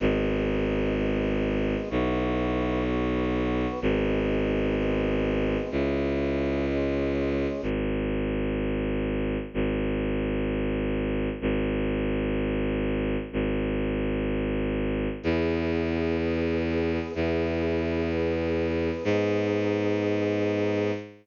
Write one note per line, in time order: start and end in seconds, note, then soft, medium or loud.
0.00 1.76 G#1 loud
0.00 0.94 B3 medium
0.00 0.94 D#4 medium
0.00 0.94 G#4 medium
0.95 1.89 G#3 medium
0.95 1.89 B3 medium
0.95 1.89 G#4 medium
1.89 3.66 B1 loud
1.89 2.83 B3 medium
1.89 2.83 E4 medium
1.89 2.83 F#4 medium
2.85 3.80 B3 medium
2.85 3.80 F#4 medium
2.85 3.80 B4 medium
3.81 5.57 G#1 loud
3.81 4.75 B3 medium
3.81 4.76 D#4 medium
3.81 4.75 G#4 medium
4.76 5.70 G#3 medium
4.76 5.70 B3 medium
4.76 5.70 G#4 medium
5.70 7.47 C#2 medium
5.70 6.65 C#4 medium
5.70 6.65 E4 medium
5.70 6.65 G#4 medium
6.67 7.61 G#3 medium
6.67 7.61 C#4 medium
6.67 7.61 G#4 medium
7.62 9.37 G#1 medium
9.54 11.29 G#1 medium
11.41 13.17 G#1 medium
13.33 15.08 G#1 medium
15.23 16.99 E2 loud
15.23 16.17 B3 medium
15.23 16.17 E4 medium
15.23 16.17 G#4 medium
16.19 17.13 B3 medium
16.19 17.13 G#4 medium
16.19 17.13 B4 medium
17.14 18.90 E2 medium
17.14 18.08 B3 medium
17.14 18.08 E4 medium
17.14 18.08 G#4 medium
18.10 19.04 B3 medium
18.10 19.04 G#4 medium
18.10 19.04 B4 medium
19.04 20.91 G#2 loud
19.04 20.92 B3 medium
19.04 20.92 D#4 medium
19.04 20.92 G#4 loud